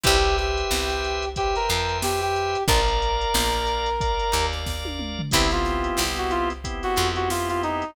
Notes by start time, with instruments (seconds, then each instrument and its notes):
0.03 electric bass (finger) C2, acoustic guitar (steel) C4 E4 G4 B4, brass section G4, drawbar organ B4 C5 E5 G5, kick, closed hi-hat
0.24 closed hi-hat
0.38 brass section G4, snare, closed hi-hat
0.57 closed hi-hat
0.71 electric bass (finger) C2, acoustic guitar (steel) C4, snare
0.90 closed hi-hat
1.04 closed hi-hat
1.22 closed hi-hat
1.36 brass section G4, drawbar organ B4 C5 E5 G5, kick, closed hi-hat
1.55 brass section A#4, closed hi-hat
1.69 electric bass (finger) F2, acoustic guitar (steel) F3, brass section A#4, snare, closed hi-hat
1.89 closed hi-hat
2.02 brass section G4, snare
2.21 brass section G4, closed hi-hat
2.36 closed hi-hat
2.55 closed hi-hat
2.68 electric bass (finger) A#1, acoustic guitar (steel) D4 F4 A#4, brass section A#4, drawbar organ A#4 D5 F5, kick, closed hi-hat
2.88 closed hi-hat
3.02 closed hi-hat
3.21 closed hi-hat
3.34 electric bass (finger) A#1, acoustic guitar (steel) A#3, snare
3.53 closed hi-hat
3.67 closed hi-hat
3.86 closed hi-hat
4.01 drawbar organ A#4 D5 F5, kick, closed hi-hat
4.19 closed hi-hat
4.32 electric bass (finger) D#2, acoustic guitar (steel) D#4, closed hi-hat
4.52 snare, closed hi-hat
4.66 kick, snare
4.85 high tom
4.99 mid tom
5.19 floor tom
5.31 electric bass (finger) C2, drawbar organ B3 C4 E4 G4, acoustic guitar (steel) C4 E4 G4 B4, brass section E4, kick, crash
5.51 brass section F4, snare, closed hi-hat
5.65 snare, closed hi-hat
5.84 closed hi-hat
5.97 electric bass (finger) C2, acoustic guitar (steel) C4, snare
6.16 brass section F#4, closed hi-hat
6.30 brass section F4, snare, closed hi-hat
6.50 closed hi-hat
6.64 drawbar organ B3 C4 E4 G4, kick, closed hi-hat
6.83 brass section F#4, snare, closed hi-hat
6.96 electric bass (finger) F2, acoustic guitar (steel) F3, closed hi-hat
7.16 brass section F#4, closed hi-hat
7.30 brass section F4, snare
7.49 brass section F4, closed hi-hat
7.63 brass section D#4, closed hi-hat
7.82 closed hi-hat